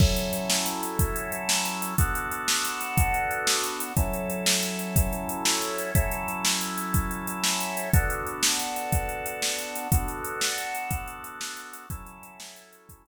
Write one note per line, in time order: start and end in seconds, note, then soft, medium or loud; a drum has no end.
0.00 1.94 F#3 medium
0.00 1.94 C#4 medium
0.00 1.94 E4 medium
0.00 1.94 A4 medium
0.00 kick loud
0.00 crash medium
0.16 closed hi-hat medium
0.33 closed hi-hat medium
0.50 snare loud
0.66 closed hi-hat medium
0.83 closed hi-hat medium
0.99 kick loud
0.99 closed hi-hat loud
1.16 closed hi-hat medium
1.32 closed hi-hat medium
1.49 snare loud
1.65 closed hi-hat medium
1.82 closed hi-hat medium
1.98 3.92 B3 medium
1.98 3.92 D4 medium
1.98 3.92 F#4 medium
1.98 3.92 A4 medium
1.98 kick loud
1.98 closed hi-hat loud
2.15 closed hi-hat medium
2.31 closed hi-hat medium
2.48 snare loud
2.65 closed hi-hat medium
2.81 closed hi-hat medium
2.97 kick loud
2.97 closed hi-hat loud
3.14 closed hi-hat medium
3.31 closed hi-hat medium
3.47 snare loud
3.64 closed hi-hat medium
3.80 closed hi-hat medium
3.97 5.91 F#3 medium
3.97 5.91 C#4 medium
3.97 5.91 E4 medium
3.97 5.91 A4 medium
3.97 kick loud
3.97 closed hi-hat medium
4.13 closed hi-hat medium
4.30 closed hi-hat medium
4.46 snare loud
4.63 closed hi-hat medium
4.79 closed hi-hat medium
4.96 kick loud
4.96 closed hi-hat loud
5.13 closed hi-hat medium
5.29 closed hi-hat medium
5.45 snare loud
5.62 closed hi-hat medium
5.78 closed hi-hat medium
5.95 7.89 F#3 medium
5.95 7.89 C#4 medium
5.95 7.89 E4 medium
5.95 7.89 A4 medium
5.95 kick loud
5.95 closed hi-hat loud
6.11 closed hi-hat medium
6.28 closed hi-hat medium
6.45 snare loud
6.61 closed hi-hat medium
6.78 closed hi-hat medium
6.94 kick medium
6.94 closed hi-hat medium
7.11 closed hi-hat medium
7.27 closed hi-hat medium
7.44 snare loud
7.60 closed hi-hat medium
7.77 closed hi-hat medium
7.93 9.88 B3 medium
7.93 9.88 D4 medium
7.93 9.88 F#4 medium
7.93 9.88 A4 medium
7.93 kick loud
7.93 closed hi-hat loud
8.10 closed hi-hat medium
8.27 closed hi-hat medium
8.43 snare loud
8.60 closed hi-hat medium
8.76 closed hi-hat medium
8.92 kick medium
8.92 closed hi-hat medium
9.09 closed hi-hat medium
9.26 closed hi-hat medium
9.42 snare loud
9.59 closed hi-hat medium
9.76 closed hi-hat medium
9.92 11.86 B3 medium
9.92 11.86 D4 medium
9.92 11.86 F#4 medium
9.92 11.86 A4 medium
9.92 kick loud
9.92 closed hi-hat loud
10.08 closed hi-hat medium
10.24 closed hi-hat medium
10.41 snare loud
10.58 closed hi-hat medium
10.75 closed hi-hat medium
10.91 kick medium
10.91 closed hi-hat loud
11.08 closed hi-hat medium
11.24 closed hi-hat medium
11.41 snare loud
11.57 closed hi-hat medium
11.73 closed hi-hat medium
11.90 13.07 F#3 medium
11.90 13.07 C#4 medium
11.90 13.07 E4 medium
11.90 13.07 A4 medium
11.90 kick loud
11.90 closed hi-hat loud
12.06 closed hi-hat medium
12.23 closed hi-hat medium
12.40 snare loud
12.56 closed hi-hat medium
12.73 closed hi-hat medium
12.89 kick medium
12.89 closed hi-hat loud
13.06 closed hi-hat medium